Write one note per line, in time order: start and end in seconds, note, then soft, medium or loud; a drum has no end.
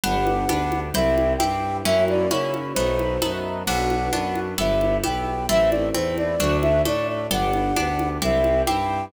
0.04 0.44 G1 medium
0.04 0.45 B3 loud
0.04 0.94 B3 loud
0.04 0.45 D4 medium
0.04 0.94 D4 loud
0.04 0.45 G4 loud
0.04 0.94 G4 loud
0.04 0.80 F#5 medium
0.04 low conga medium
0.27 high conga medium
0.49 0.90 D2 medium
0.49 0.90 B3 medium
0.49 0.90 D4 medium
0.49 0.90 G4 medium
0.49 high conga medium
0.72 high conga medium
0.94 1.35 C2 loud
0.94 1.36 C4 medium
0.94 1.85 C4 medium
0.94 1.36 E4 medium
0.94 1.85 E4 medium
0.94 1.36 G4 medium
0.94 1.85 G4 medium
0.94 1.33 E5 medium
0.94 low conga medium
1.18 high conga medium
1.38 1.81 G2 medium
1.38 1.81 C4 medium
1.38 1.81 E4 medium
1.38 1.81 G4 medium
1.38 1.77 G5 medium
1.38 high conga medium
1.85 2.26 F#2 medium
1.85 2.26 A#3 medium
1.85 2.75 A#3 medium
1.85 2.26 C#4 medium
1.85 2.75 C#4 medium
1.85 2.26 E4 medium
1.85 2.75 E4 loud
1.85 2.26 F#4 medium
1.85 2.75 F#4 loud
1.85 2.04 E5 medium
1.85 low conga loud
2.08 2.30 D5 medium
2.08 high conga medium
2.31 2.72 C#3 medium
2.31 2.72 A#3 medium
2.31 2.72 C#4 medium
2.31 2.72 E4 medium
2.31 2.72 F#4 medium
2.31 2.53 C#5 medium
2.31 high conga medium
2.54 high conga medium
2.74 3.17 B1 medium
2.74 3.17 A3 medium
2.74 3.67 A3 medium
2.74 3.17 B3 medium
2.74 3.67 B3 loud
2.74 3.17 D#4 loud
2.74 3.67 D#4 medium
2.74 3.17 F#4 medium
2.74 3.67 F#4 medium
2.74 3.32 C5 medium
2.74 low conga medium
2.99 high conga medium
3.22 3.63 F#2 medium
3.22 3.63 A3 medium
3.22 3.63 B3 medium
3.22 3.63 D#4 medium
3.22 3.63 F#4 medium
3.22 high conga medium
3.66 4.09 B1 medium
3.66 4.57 B3 medium
3.66 4.08 B3 medium
3.66 4.57 D4 loud
3.66 4.08 D4 medium
3.66 4.57 F#4 loud
3.66 4.08 F#4 loud
3.66 4.40 F#5 medium
3.66 crash loud
3.66 low conga medium
3.90 high conga medium
4.13 4.54 F#2 medium
4.13 4.54 B3 medium
4.13 4.54 D4 medium
4.13 4.54 F#4 medium
4.13 high conga medium
4.36 high conga medium
4.58 4.98 G1 loud
4.58 4.99 B3 medium
4.58 5.49 B3 loud
4.58 4.99 E4 medium
4.58 5.48 E4 loud
4.58 4.99 G4 medium
4.58 5.49 G4 medium
4.58 4.97 E5 medium
4.58 low conga medium
4.81 high conga medium
5.04 5.45 B1 medium
5.04 5.45 B3 medium
5.04 5.45 E4 medium
5.04 5.45 G4 medium
5.04 5.46 G5 medium
5.04 high conga medium
5.49 5.90 A1 medium
5.49 6.39 A3 medium
5.49 5.90 A3 loud
5.49 6.39 C4 medium
5.49 5.90 C4 medium
5.49 6.39 E4 medium
5.49 5.90 E4 loud
5.49 5.70 E5 medium
5.49 low conga medium
5.70 5.89 D5 medium
5.70 high conga medium
5.94 6.36 E2 medium
5.94 6.35 A3 medium
5.94 6.35 C4 medium
5.94 6.35 E4 medium
5.94 6.16 C5 medium
5.94 high conga medium
6.18 6.57 D5 medium
6.18 high conga medium
6.39 6.81 D2 loud
6.39 7.29 A3 medium
6.39 6.81 A3 medium
6.39 7.29 D4 medium
6.39 6.81 D4 medium
6.39 7.29 F#4 medium
6.39 6.81 F#4 medium
6.39 low conga medium
6.62 6.82 E5 medium
6.62 high conga medium
6.85 7.26 A2 medium
6.85 7.26 A3 medium
6.85 7.26 D4 medium
6.85 7.26 F#4 medium
6.85 7.07 D5 medium
6.85 high conga medium
7.08 7.27 D5 medium
7.30 7.71 G1 medium
7.30 7.72 B3 loud
7.30 8.21 B3 loud
7.30 7.72 D4 medium
7.30 8.21 D4 loud
7.30 7.72 G4 loud
7.30 8.21 G4 loud
7.30 8.09 F#5 medium
7.30 low conga medium
7.53 high conga medium
7.76 8.18 D2 medium
7.76 8.17 B3 medium
7.76 8.17 D4 medium
7.76 8.17 G4 medium
7.76 high conga medium
7.99 high conga medium
8.21 8.62 C2 loud
8.21 9.11 C4 medium
8.21 8.63 C4 medium
8.21 9.11 E4 medium
8.21 8.63 E4 medium
8.21 9.11 G4 medium
8.21 8.63 G4 medium
8.21 8.62 E5 medium
8.21 low conga medium
8.44 high conga medium
8.66 9.09 G2 medium
8.66 9.08 C4 medium
8.66 9.08 E4 medium
8.66 9.08 G4 medium
8.66 9.05 G5 medium
8.66 high conga medium